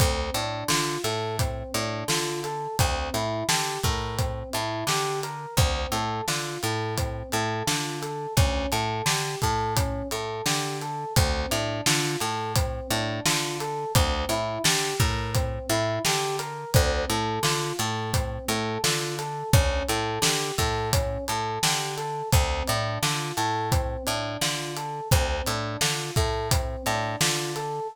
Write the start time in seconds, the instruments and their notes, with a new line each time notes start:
0.00 electric bass (finger) D2, electric piano 1 C4, kick, closed hi-hat
0.34 electric bass (finger) A2, electric piano 1 D4, closed hi-hat
0.68 electric bass (finger) D3, electric piano 1 F4, snare
1.04 electric bass (finger) A2, electric piano 1 A4, closed hi-hat
1.39 electric piano 1 C4, kick, closed hi-hat
1.74 electric bass (finger) A2, electric piano 1 D4, closed hi-hat
2.08 electric bass (finger) D3, electric piano 1 F4, snare
2.44 electric piano 1 A4, closed hi-hat
2.79 electric bass (finger) D2, electric piano 1 C4, kick, closed hi-hat
3.14 electric bass (finger) A2, electric piano 1 E4, closed hi-hat
3.49 electric bass (finger) D3, electric piano 1 G4, snare
3.83 electric bass (finger) A2, electric piano 1 A#4, kick, snare, closed hi-hat
4.18 electric piano 1 C4, kick, closed hi-hat
4.53 electric bass (finger) A2, electric piano 1 E4, closed hi-hat
4.87 electric bass (finger) D3, electric piano 1 G4, snare
5.23 electric piano 1 A#4, closed hi-hat
5.57 electric bass (finger) D2, electric piano 1 C4, kick, closed hi-hat
5.92 electric bass (finger) A2, electric piano 1 A4, closed hi-hat
6.28 electric bass (finger) D3, electric piano 1 F4, snare
6.63 electric bass (finger) A2, electric piano 1 A4, closed hi-hat
6.98 electric piano 1 C4, kick, closed hi-hat
7.32 electric bass (finger) A2, electric piano 1 A4, closed hi-hat
7.67 electric bass (finger) D3, electric piano 1 F4, snare
8.02 electric piano 1 A4, closed hi-hat
8.37 electric bass (finger) D2, electric piano 1 C#4, kick, closed hi-hat
8.72 electric bass (finger) A2, electric piano 1 A4, closed hi-hat
9.06 electric bass (finger) D3, electric piano 1 G4, snare
9.42 electric bass (finger) A2, electric piano 1 A4, kick, closed hi-hat
9.76 electric piano 1 C#4, kick, closed hi-hat
10.11 electric bass (finger) A2, electric piano 1 A4, closed hi-hat
10.46 electric bass (finger) D3, electric piano 1 G4, snare
10.82 electric piano 1 A4, closed hi-hat
11.16 electric bass (finger) D2, electric piano 1 C4, kick, closed hi-hat
11.51 electric bass (finger) A2, electric piano 1 D4, closed hi-hat
11.86 electric bass (finger) D3, electric piano 1 F4, snare
12.20 electric bass (finger) A2, electric piano 1 A4, closed hi-hat
12.56 electric piano 1 C4, kick, closed hi-hat
12.91 electric bass (finger) A2, electric piano 1 D4, closed hi-hat
13.25 electric bass (finger) D3, electric piano 1 F4, snare
13.60 electric piano 1 A4, closed hi-hat
13.95 electric bass (finger) D2, electric piano 1 C4, kick, closed hi-hat
14.29 electric bass (finger) A2, electric piano 1 E4, closed hi-hat
14.64 electric bass (finger) D3, electric piano 1 G4, snare
15.00 electric bass (finger) A2, electric piano 1 A#4, kick, snare, closed hi-hat
15.35 electric piano 1 C4, kick, closed hi-hat
15.69 electric bass (finger) A2, electric piano 1 E4, closed hi-hat
16.05 electric bass (finger) D3, electric piano 1 G4, snare
16.39 electric piano 1 A#4, closed hi-hat
16.74 electric bass (finger) D2, electric piano 1 C4, kick, closed hi-hat
17.10 electric bass (finger) A2, electric piano 1 A4, closed hi-hat
17.43 electric bass (finger) D3, electric piano 1 F4, snare
17.79 electric bass (finger) A2, electric piano 1 A4, closed hi-hat
18.14 electric piano 1 C4, kick, closed hi-hat
18.48 electric bass (finger) A2, electric piano 1 A4, closed hi-hat
18.84 electric bass (finger) D3, electric piano 1 F4, snare
19.19 electric piano 1 A4, closed hi-hat
19.53 electric bass (finger) D2, electric piano 1 C#4, kick, closed hi-hat
19.89 electric bass (finger) A2, electric piano 1 A4, closed hi-hat
20.22 electric bass (finger) D3, electric piano 1 G4, snare
20.58 electric bass (finger) A2, electric piano 1 A4, kick, closed hi-hat
20.93 electric piano 1 C#4, kick, closed hi-hat
21.28 electric bass (finger) A2, electric piano 1 A4, closed hi-hat
21.63 electric bass (finger) D3, electric piano 1 G4, snare
21.97 electric piano 1 A4, closed hi-hat
22.32 electric bass (finger) D2, electric piano 1 C4, kick, closed hi-hat
22.67 electric bass (finger) A2, electric piano 1 D4, closed hi-hat
23.02 electric bass (finger) D3, electric piano 1 F4, snare
23.37 electric bass (finger) A2, electric piano 1 A4, closed hi-hat
23.72 electric piano 1 C4, kick, closed hi-hat
24.07 electric bass (finger) A2, electric piano 1 D4, closed hi-hat
24.41 electric bass (finger) D3, electric piano 1 F4, snare
24.76 electric piano 1 A4, closed hi-hat
25.11 electric bass (finger) D2, electric piano 1 C4, kick, closed hi-hat
25.47 electric bass (finger) A2, electric piano 1 D4, closed hi-hat
25.81 electric bass (finger) D3, electric piano 1 F4, snare
26.16 electric bass (finger) A2, electric piano 1 A4, kick, closed hi-hat
26.51 electric piano 1 C4, kick, closed hi-hat
26.86 electric bass (finger) A2, electric piano 1 D4, snare, closed hi-hat
27.21 electric bass (finger) D3, electric piano 1 F4, snare
27.56 electric piano 1 A4, closed hi-hat